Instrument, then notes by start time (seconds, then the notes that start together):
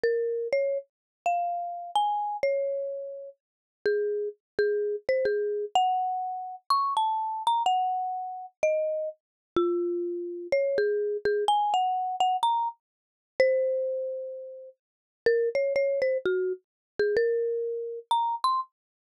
marimba
0.03 A#4
0.53 C#5
1.26 F5
1.95 G#5
2.43 C#5
3.86 G#4
4.59 G#4
5.09 C5
5.25 G#4
5.75 F#5
6.70 C#6
6.97 A5
7.47 A#5
7.66 F#5
8.63 D#5
9.56 F4
10.52 C#5
10.78 G#4
11.25 G#4
11.48 G#5
11.74 F#5
12.20 F#5
12.43 A#5
13.40 C5
15.26 A#4
15.55 C#5
15.76 C#5
16.02 C5
16.25 F#4
16.99 G#4
17.17 A#4
18.11 A#5
18.44 C6